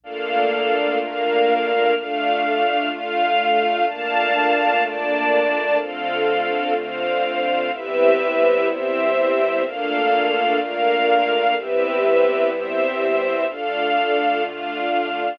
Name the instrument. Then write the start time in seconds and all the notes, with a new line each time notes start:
string ensemble 1
0.04 A#2 A3 A#3 D4 F4 A4 F5
1.00 A#3 D4 A#4 F5
1.95 A3 D4 F4 F5
2.90 A3 F4 F5
3.87 A#2 A3 A#3 D4 F4 F5 A5
4.83 A#3 D4 D5 A5
5.79 D3 A3 C4 F4 A4 F5
6.76 D3 C4 C5 F5
7.71 C3 G3 B3 C4 E4 G4 B4 E5
8.68 C4 G4 C5 E5
9.64 A#2 A3 A#3 D4 F4 A4 F5
10.59 A#3 D4 A#4 F5
11.55 C3 G3 B3 C4 E4 G4 B4 E5
12.50 C4 G4 C5 E5
13.47 D3 A3 D4 F4 A4 F5
14.43 D4 F4 F5